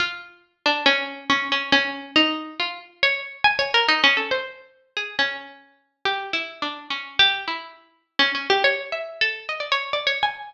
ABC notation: X:1
M:2/4
L:1/16
Q:1/4=139
K:none
V:1 name="Pizzicato Strings"
F6 D2 | _D4 D2 D2 | _D4 _E4 | F2 z2 _d2 z2 |
(3_a2 _d2 _B2 (3_E2 _D2 =A2 | c6 _A2 | _D8 | (3G4 E4 D4 |
(3_D4 G4 E4 | z4 (3_D2 D2 G2 | (3_d4 e4 A4 | _e d _d2 (3=d2 _d2 _a2 |]